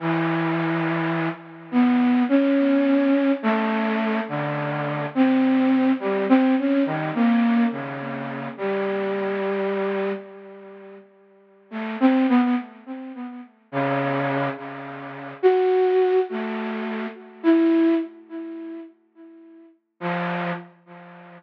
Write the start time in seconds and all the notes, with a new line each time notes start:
0.00 E3
1.71 B3
2.29 C#4
3.43 A3
4.28 D3
5.15 C4
6.00 G3
6.29 C4
6.58 C#4
6.85 D#3
7.14 A#3
7.71 C#3
8.57 G3
11.71 A3
12.00 C4
12.29 B3
12.42 B3
13.72 C#3
14.56 C#3
15.43 F#4
16.30 A3
17.43 E4
20.00 F3